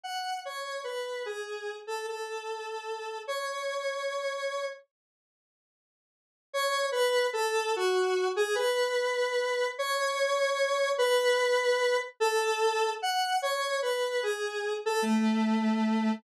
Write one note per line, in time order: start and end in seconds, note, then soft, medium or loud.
0.04 0.39 F#5 medium
0.45 0.81 C#5 medium
0.84 1.23 B4 medium
1.26 1.76 G#4 medium
1.87 2.06 A4 medium
2.08 3.18 A4 medium
3.28 4.66 C#5 medium
6.53 6.86 C#5 loud
6.92 7.27 B4 loud
7.33 7.72 A4 loud
7.76 8.28 F#4 loud
8.36 8.55 G#4 loud
8.55 9.67 B4 loud
9.79 10.91 C#5 loud
10.98 11.97 B4 loud
12.20 12.90 A4 loud
13.02 13.38 F#5 loud
13.42 13.78 C#5 loud
13.82 14.21 B4 medium
14.23 14.73 G#4 medium
14.86 15.05 A4 loud
15.02 16.12 A3 loud